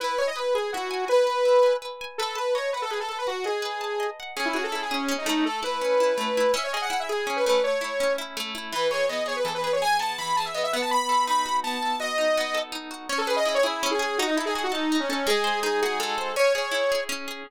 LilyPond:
<<
  \new Staff \with { instrumentName = "Lead 2 (sawtooth)" } { \time 6/8 \key e \major \tempo 4. = 110 b'8 cis''16 dis''16 b'8 gis'8 fis'4 | b'2 r4 | a'8 b'8 cis''8 b'16 a'16 gis'16 a'16 a'16 b'16 | fis'8 gis'2 r8 |
\key cis \minor gis'16 e'16 fis'16 a'16 a'16 gis'16 cis'8. dis'16 dis'8 | a'8 b'2~ b'8 | e''16 cis''16 dis''16 fis''16 fis''16 e''16 gis'8. b'16 b'8 | cis''4. r4. |
\key e \major b'8 cis''8 dis''8 cis''16 b'16 a'16 b'16 b'16 cis''16 | gis''8 a''8 b''8 a''16 e''16 dis''16 e''16 fis''16 a''16 | b''4 b''4 a''4 | dis''2 r4 |
\key cis \minor cis''16 a'16 b'16 dis''16 dis''16 cis''16 e'8. gis'16 gis'8 | fis'16 dis'16 e'16 gis'16 gis'16 fis'16 dis'8. cis'16 cis'8 | gis'4 gis'8 gis'8 a'4 | cis''8 cis''4. r4 | }
  \new Staff \with { instrumentName = "Acoustic Guitar (steel)" } { \time 6/8 \key e \major e'8 gis''8 b'8 gis''8 e'8 gis''8 | gis''8 b'8 e'8 gis''8 b'8 gis''8 | b'8 a''8 dis''8 fis''8 b'8 a''8 | fis''8 dis''8 b'8 a''8 dis''8 fis''8 |
\key cis \minor cis'8 gis'8 e'8 gis'8 cis'8 a8~ | a8 e'8 cis'8 e'8 a8 e'8 | cis'8 gis'8 e'8 gis'8 cis'8 a8~ | a8 e'8 cis'8 e'8 a8 e'8 |
\key e \major e8 gis'8 b8 gis'8 e8 gis'8 | gis'8 b8 e8 gis'8 b8 b8~ | b8 a'8 dis'8 fis'8 b8 a'8 | fis'8 dis'8 b8 a'8 dis'8 fis'8 |
\key cis \minor cis'8 gis'8 e'8 gis'8 cis'8 gis'8 | dis'8 a'8 fis'8 a'8 dis'8 a'8 | gis8 bis'8 dis'8 fis'8 gis8 bis'8 | cis'8 gis'8 e'8 gis'8 cis'8 gis'8 | }
>>